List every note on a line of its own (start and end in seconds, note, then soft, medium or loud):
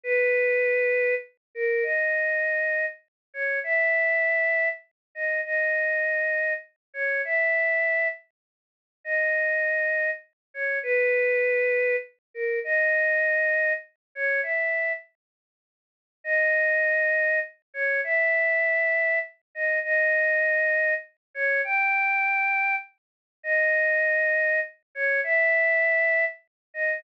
0.04 1.15 B4 loud
1.55 1.84 A#4 medium
1.83 2.86 D#5 medium
3.34 3.59 C#5 medium
3.64 4.69 E5 loud
5.15 5.41 D#5 medium
5.45 6.53 D#5 medium
6.94 7.22 C#5 medium
7.25 8.08 E5 medium
9.04 10.10 D#5 medium
10.54 10.79 C#5 medium
10.83 11.96 B4 loud
12.34 12.59 A#4 medium
12.64 13.73 D#5 loud
14.15 14.41 C#5 medium
14.43 14.93 E5 medium
16.24 17.39 D#5 loud
17.74 18.01 C#5 medium
18.04 19.19 E5 loud
19.55 19.79 D#5 medium
19.84 20.94 D#5 loud
21.34 21.61 C#5 medium
21.64 22.75 G5 medium
23.43 24.60 D#5 loud
24.95 25.21 C#5 medium
25.24 26.25 E5 loud
26.74 27.00 D#5 medium